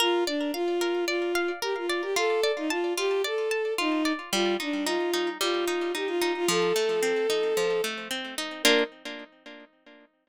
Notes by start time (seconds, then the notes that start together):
0.00 F4 A#4
0.27 D4 D5
0.53 F4 F5
0.81 A#4
1.07 F4 D5
1.35 F5
1.62 G4 A#4
1.77 F4
1.89 D5
2.02 G4
2.16 F4 A4
2.43 D5
2.57 D#4
2.70 F4 A5
2.97 F4 G4
3.24 A4 D5
3.51 A5
3.78 D#4 F4
4.05 D5
4.33 G3 F4
4.60 D4 D#4
4.85 D#4 F4
5.14 D#4
5.40 G3 F4
5.67 D#4
5.95 D#4 G4
6.07 F4
6.22 D#4
6.36 F4
6.48 F3 A4
6.76 A3
7.03 C4
7.30 D#4
7.57 F3
7.84 A3
8.11 C4
8.38 D#4
8.63 A#3 D4 F4 A#4